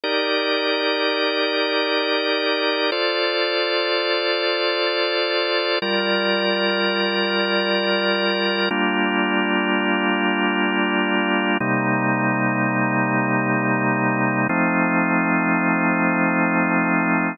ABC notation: X:1
M:4/4
L:1/8
Q:"Swing 16ths" 1/4=83
K:Gm
V:1 name="Drawbar Organ"
[EGBd]8 | [FAcd]8 | [G,FBd]8 | [G,B,DF]8 |
[C,G,B,E]8 | [F,A,CE]8 |]